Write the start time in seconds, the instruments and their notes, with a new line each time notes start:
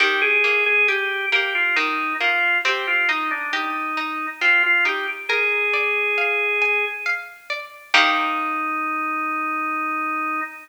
0.00 harpsichord D#3, drawbar organ G4
0.22 drawbar organ G#4
0.44 harpsichord A#3
0.66 drawbar organ G#4
0.88 drawbar organ G4, harpsichord G4
1.32 harpsichord A#3, drawbar organ G4
1.55 drawbar organ F4
1.76 harpsichord D#3, drawbar organ D#4
2.20 harpsichord A#3, drawbar organ F4
2.65 harpsichord C4, drawbar organ G4
2.87 drawbar organ F4
3.09 drawbar organ D#4, harpsichord D#4
3.31 drawbar organ D4
3.53 drawbar organ D#4, harpsichord G4
3.97 harpsichord D#4
4.41 harpsichord C4, drawbar organ F4
4.63 drawbar organ F4
4.85 harpsichord D#4, drawbar organ G4
5.29 drawbar organ G#4, harpsichord A#4
5.74 harpsichord D5
6.18 harpsichord F5
6.62 harpsichord G#5
7.06 harpsichord F5
7.50 harpsichord D5
7.94 harpsichord D#3 A#3 G4, drawbar organ D#4